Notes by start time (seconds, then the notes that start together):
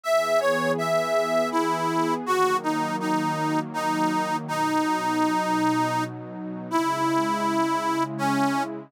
0.04 E3 B3 G#4 E5
0.40 C#5
0.78 E5
1.51 E4
2.26 D#3 F#3 A#3 F#4
2.63 D#4
3.00 D#4
3.74 D#4
4.48 B2 F#3 D#4
6.70 C#3 G#3 E4
8.18 C#4